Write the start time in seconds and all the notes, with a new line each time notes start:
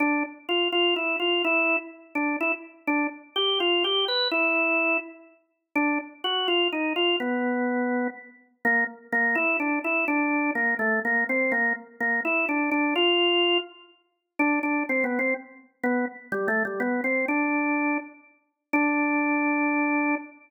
0.00 D4
0.49 F4
0.72 F4
0.96 E4
1.20 F4
1.45 E4
2.15 D4
2.41 E4
2.87 D4
3.36 G4
3.60 F4
3.84 G4
4.08 B4
4.31 E4
5.75 D4
6.24 F#4
6.48 F4
6.72 D#4
6.96 F4
7.20 B3
8.65 A#3
9.12 A#3
9.35 E4
9.60 D4
9.84 E4
10.08 D4
10.55 A#3
10.79 A3
11.05 A#3
11.29 C4
11.52 A#3
12.00 A#3
12.25 E4
12.49 D4
12.71 D4
12.96 F4
14.39 D4
14.63 D4
14.89 C4
15.04 B3
15.19 C4
15.84 B3
16.32 G3
16.48 A3
16.65 G3
16.80 B3
17.04 C4
17.28 D4
18.73 D4